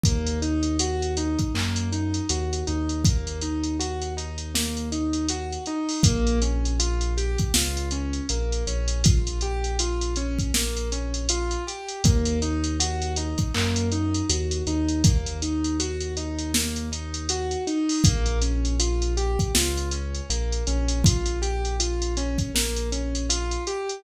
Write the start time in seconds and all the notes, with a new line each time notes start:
0.04 D#2 A#3, kick, closed hi-hat
0.27 closed hi-hat
0.42 D#4, closed hi-hat
0.63 closed hi-hat
0.79 F#4, closed hi-hat
1.02 closed hi-hat
1.17 D#4, closed hi-hat
1.39 kick, closed hi-hat
1.54 F#2 A#3, clap
1.76 closed hi-hat
1.92 D#4, closed hi-hat
2.14 closed hi-hat
2.29 D#2 F#4, closed hi-hat
2.53 closed hi-hat
2.67 D#2 D#4, closed hi-hat
2.89 closed hi-hat
3.05 A#3, kick, closed hi-hat
3.27 closed hi-hat
3.42 D#4, closed hi-hat
3.64 closed hi-hat
3.80 F#4, closed hi-hat
4.02 closed hi-hat
4.17 D#4, closed hi-hat
4.38 closed hi-hat
4.55 A#3, snare
4.77 closed hi-hat
4.92 D#4, closed hi-hat
5.13 closed hi-hat
5.29 F#4, closed hi-hat
5.53 closed hi-hat
5.66 D#4, closed hi-hat
5.89 open hi-hat
6.03 A#1 A#3, kick, closed hi-hat
6.27 closed hi-hat
6.42 C#4, closed hi-hat
6.65 closed hi-hat
6.80 F4, closed hi-hat
7.01 closed hi-hat
7.17 G4, closed hi-hat
7.38 kick, closed hi-hat
7.54 C#2 F4, snare
7.77 closed hi-hat
7.91 C#4, closed hi-hat
8.13 closed hi-hat
8.29 A#1 A#3, closed hi-hat
8.53 closed hi-hat
8.67 A#1 C#4, closed hi-hat
8.88 closed hi-hat
9.04 F4, kick, closed hi-hat
9.27 closed hi-hat
9.41 G4, closed hi-hat
9.64 closed hi-hat
9.79 F4, closed hi-hat
10.01 closed hi-hat
10.16 C#4, closed hi-hat
10.39 kick, closed hi-hat
10.54 A#3, snare
10.77 closed hi-hat
10.92 C#4, closed hi-hat
11.14 closed hi-hat
11.29 F4, closed hi-hat
11.51 closed hi-hat
11.67 G4, closed hi-hat
11.89 closed hi-hat
12.04 D#2 A#3, kick, closed hi-hat
12.25 closed hi-hat
12.42 D#4, closed hi-hat
12.64 closed hi-hat
12.80 F#4, closed hi-hat
13.02 closed hi-hat
13.16 D#4, closed hi-hat
13.38 kick, closed hi-hat
13.55 F#2 A#3, clap
13.76 closed hi-hat
13.92 D#4, closed hi-hat
14.15 closed hi-hat
14.30 D#2 F#4, closed hi-hat
14.51 closed hi-hat
14.67 D#2 D#4, closed hi-hat
14.89 closed hi-hat
15.04 A#3, kick, closed hi-hat
15.26 closed hi-hat
15.42 D#4, closed hi-hat
15.64 closed hi-hat
15.80 F#4, closed hi-hat
16.01 closed hi-hat
16.17 D#4, closed hi-hat
16.39 closed hi-hat
16.54 A#3, snare
16.76 closed hi-hat
16.92 D#4, closed hi-hat
17.14 closed hi-hat
17.29 F#4, closed hi-hat
17.51 closed hi-hat
17.67 D#4, closed hi-hat
17.89 open hi-hat
18.04 A#1 A#3, kick, closed hi-hat
18.26 closed hi-hat
18.42 C#4, closed hi-hat
18.65 closed hi-hat
18.80 F4, closed hi-hat
19.02 closed hi-hat
19.17 G4, closed hi-hat
19.39 kick, closed hi-hat
19.55 C#2 F4, snare
19.78 closed hi-hat
19.91 C#4, closed hi-hat
20.15 closed hi-hat
20.30 A#1 A#3, closed hi-hat
20.53 closed hi-hat
20.67 A#1 C#4, closed hi-hat
20.88 closed hi-hat
21.04 F4, kick, closed hi-hat
21.26 closed hi-hat
21.42 G4, closed hi-hat
21.65 closed hi-hat
21.80 F4, closed hi-hat
22.02 closed hi-hat
22.17 C#4, closed hi-hat
22.38 kick, closed hi-hat
22.55 A#3, snare
22.77 closed hi-hat
22.92 C#4, closed hi-hat
23.15 closed hi-hat
23.30 F4, closed hi-hat
23.51 closed hi-hat
23.67 G4, closed hi-hat
23.89 closed hi-hat